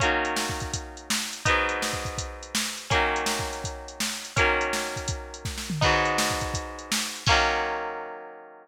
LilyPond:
<<
  \new Staff \with { instrumentName = "Acoustic Guitar (steel)" } { \time 4/4 \key ees \dorian \tempo 4 = 165 <ees ges bes des'>1 | <aes, ges ces' ees'>1 | <ees ges bes des'>1 | <ees ges bes des'>1 |
<aes, ges ces' ees'>1 | <ees ges bes des'>1 | }
  \new DrumStaff \with { instrumentName = "Drums" } \drummode { \time 4/4 \tuplet 3/2 { <hh bd>8 r8 hh8 sn8 bd8 <hh bd>8 <hh bd>8 r8 hh8 sn8 r8 hh8 } | \tuplet 3/2 { <hh bd>8 r8 hh8 sn8 bd8 <bd hh>8 <hh bd>8 r8 hh8 sn8 r8 hh8 } | \tuplet 3/2 { <hh bd>8 r8 hh8 sn8 bd8 hh8 <hh bd>8 r8 hh8 sn8 r8 hh8 } | \tuplet 3/2 { <hh bd>8 r8 hh8 sn8 r8 <hh bd>8 <hh bd>8 r8 hh8 <bd sn>8 sn8 tomfh8 } |
\tuplet 3/2 { <cymc bd>8 r8 hh8 sn8 bd8 <hh bd>8 <hh bd>8 r8 hh8 sn8 r8 hh8 } | <cymc bd>4 r4 r4 r4 | }
>>